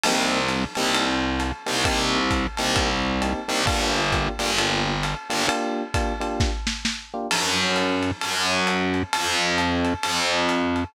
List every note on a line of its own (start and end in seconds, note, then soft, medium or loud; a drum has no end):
0.04 0.64 C2 medium
0.04 0.39 A#3 loud
0.04 0.39 C4 loud
0.04 0.39 D#4 loud
0.04 0.39 G4 medium
0.04 crash medium
0.04 ride medium
0.49 hi-hat pedal medium
0.49 ride medium
0.75 1.52 C2 medium
0.75 1.06 A#3 medium
0.75 1.06 C4 medium
0.75 1.06 D#4 medium
0.75 1.06 G4 medium
0.75 ride medium
0.95 ride medium
1.40 hi-hat pedal medium
1.40 ride medium
1.66 1.84 C2 medium
1.66 1.79 A#3 medium
1.66 1.79 C4 medium
1.66 1.79 D#4 medium
1.66 1.79 G4 medium
1.66 ride medium
1.85 2.47 C2 medium
1.85 2.19 A#3 loud
1.85 2.19 C4 loud
1.85 2.19 D#4 medium
1.85 2.19 G4 loud
1.85 kick medium
1.85 ride medium
2.31 kick medium
2.31 hi-hat pedal medium
2.31 ride medium
2.57 3.33 C2 medium
2.57 2.88 A#3 medium
2.57 2.88 C4 medium
2.57 2.88 D#4 medium
2.57 2.88 G4 medium
2.57 ride medium
2.76 kick medium
2.76 ride medium
3.22 3.40 A#3 medium
3.22 3.40 C4 medium
3.22 3.40 D#4 medium
3.22 3.40 G4 medium
3.22 hi-hat pedal medium
3.22 ride medium
3.48 3.65 C2 medium
3.48 3.61 A#3 medium
3.48 3.61 C4 medium
3.48 3.61 D#4 medium
3.48 3.61 G4 medium
3.48 ride medium
3.67 4.28 G1 medium
3.67 4.01 A#3 medium
3.67 4.01 D4 loud
3.67 4.01 F4 medium
3.67 4.01 G4 medium
3.67 kick medium
3.67 ride medium
4.12 4.31 A#3 medium
4.12 4.31 D4 medium
4.12 4.31 F4 medium
4.12 4.31 G4 medium
4.12 kick medium
4.12 hi-hat pedal medium
4.12 ride medium
4.39 5.15 G1 medium
4.39 4.52 A#3 medium
4.39 4.52 D4 medium
4.39 4.52 F4 medium
4.39 4.52 G4 medium
4.39 ride medium
4.58 4.92 A#3 medium
4.58 4.92 D4 medium
4.58 4.92 F4 medium
4.58 4.92 G4 medium
4.58 ride medium
5.03 hi-hat pedal medium
5.03 ride medium
5.30 5.47 G1 medium
5.30 5.43 A#3 medium
5.30 5.43 D4 medium
5.30 5.43 F4 medium
5.30 5.43 G4 medium
5.30 ride medium
5.48 5.82 A#3 loud
5.48 5.82 D4 loud
5.48 5.82 F4 medium
5.48 5.82 G4 medium
5.48 ride medium
5.94 6.13 A#3 medium
5.94 6.13 D4 medium
5.94 6.13 F4 medium
5.94 6.13 G4 medium
5.94 kick medium
5.94 hi-hat pedal medium
5.94 ride medium
6.20 6.50 A#3 medium
6.20 6.50 D4 medium
6.20 6.50 F4 medium
6.20 6.50 G4 medium
6.20 ride medium
6.40 kick medium
6.40 snare medium
6.67 snare medium
6.85 snare medium
7.14 7.27 A#3 medium
7.14 7.27 D4 medium
7.14 7.27 F4 medium
7.14 7.27 G4 medium
7.31 8.11 F#2 loud
7.31 crash medium
7.31 ride medium
7.76 hi-hat pedal medium
7.76 ride medium
8.03 ride medium
8.21 9.03 F#2 loud
8.21 ride medium
8.67 hi-hat pedal medium
8.67 ride medium
8.94 ride medium
9.13 9.94 F2 loud
9.13 ride loud
9.58 hi-hat pedal medium
9.58 ride medium
9.85 ride medium
10.03 10.84 F2 medium
10.03 ride medium
10.49 hi-hat pedal medium
10.49 ride medium
10.76 ride medium